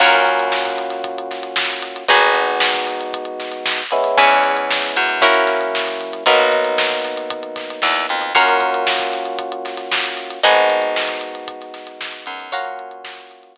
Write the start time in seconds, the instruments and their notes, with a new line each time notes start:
0.00 electric bass (finger) F#2, electric piano 1 A#3 C#4 F4 F#4, acoustic guitar (steel) F4 F#4 A#4 C#5, kick, crash
0.13 snare, closed hi-hat
0.26 kick, closed hi-hat
0.39 closed hi-hat
0.52 snare
0.65 kick, closed hi-hat
0.78 closed hi-hat
0.90 snare, closed hi-hat
1.04 kick, closed hi-hat
1.18 closed hi-hat
1.31 snare, closed hi-hat
1.43 closed hi-hat
1.56 snare
1.70 snare, closed hi-hat
1.82 closed hi-hat
1.96 closed hi-hat
2.08 electric bass (finger) G#1, electric piano 1 G#3 B3 D#4 F#4, acoustic guitar (steel) D#4 F#4 G#4 B4, kick, closed hi-hat
2.21 closed hi-hat
2.35 closed hi-hat
2.48 closed hi-hat
2.60 snare
2.73 kick, snare, closed hi-hat
2.87 closed hi-hat
3.01 closed hi-hat
3.13 kick, closed hi-hat
3.25 closed hi-hat
3.40 snare, closed hi-hat
3.52 closed hi-hat
3.66 snare
3.78 closed hi-hat
3.91 electric piano 1 G#3 B3 C#4 E4, closed hi-hat
4.04 snare, closed hi-hat
4.17 electric bass (finger) E2, acoustic guitar (steel) C#4 E4 G#4 B4, kick, closed hi-hat
4.31 closed hi-hat
4.43 snare, closed hi-hat
4.57 closed hi-hat
4.71 snare
4.82 closed hi-hat
4.96 electric bass (finger) F#2, closed hi-hat
5.09 closed hi-hat
5.21 electric piano 1 F#3 A#3 C#4 E4, acoustic guitar (steel) C#4 E4 F#4 A#4, kick, closed hi-hat
5.34 closed hi-hat
5.47 snare, closed hi-hat
5.61 closed hi-hat
5.75 snare
5.87 closed hi-hat
6.01 closed hi-hat
6.13 closed hi-hat
6.26 electric bass (finger) B1, electric piano 1 F#3 A#3 B3 D#4, acoustic guitar (steel) D#4 F#4 A#4 B4, kick, closed hi-hat
6.40 closed hi-hat
6.52 kick, closed hi-hat
6.65 closed hi-hat
6.78 snare
6.91 kick, closed hi-hat
7.04 snare, closed hi-hat
7.17 closed hi-hat
7.30 kick, closed hi-hat
7.43 closed hi-hat
7.56 kick, snare, closed hi-hat
7.70 closed hi-hat
7.82 electric bass (finger) E2, snare
7.96 closed hi-hat
8.09 electric bass (finger) F2, closed hi-hat
8.22 closed hi-hat
8.35 electric bass (finger) F#2, electric piano 1 A#3 C#4 F4 F#4, acoustic guitar (steel) C#5 F5 F#5 A#5, kick, closed hi-hat
8.49 closed hi-hat
8.61 kick, closed hi-hat
8.74 closed hi-hat
8.87 snare
8.99 kick, snare, closed hi-hat
9.13 snare, closed hi-hat
9.25 closed hi-hat
9.39 kick, closed hi-hat
9.52 closed hi-hat
9.65 snare, closed hi-hat
9.77 snare, closed hi-hat
9.92 snare
10.04 closed hi-hat
10.17 snare, closed hi-hat
10.30 closed hi-hat
10.43 electric bass (finger) G#1, electric piano 1 G#3 B3 D#4 F#4, acoustic guitar (steel) D#5 F#5 G#5 B5, kick, closed hi-hat
10.56 closed hi-hat
10.70 snare, closed hi-hat
10.82 closed hi-hat
10.96 snare
11.09 kick, closed hi-hat
11.21 closed hi-hat
11.35 closed hi-hat
11.48 kick, closed hi-hat
11.61 snare, closed hi-hat
11.74 snare, closed hi-hat
11.87 snare, closed hi-hat
12.01 snare
12.13 closed hi-hat
12.26 electric bass (finger) F#2, closed hi-hat
12.40 closed hi-hat
12.52 electric piano 1 A#3 C#4 F4 F#4, acoustic guitar (steel) C#5 F5 F#5 A#5, kick, closed hi-hat
12.65 closed hi-hat
12.79 closed hi-hat
12.91 closed hi-hat
13.04 snare
13.17 kick, closed hi-hat
13.31 closed hi-hat
13.43 closed hi-hat
13.56 kick, closed hi-hat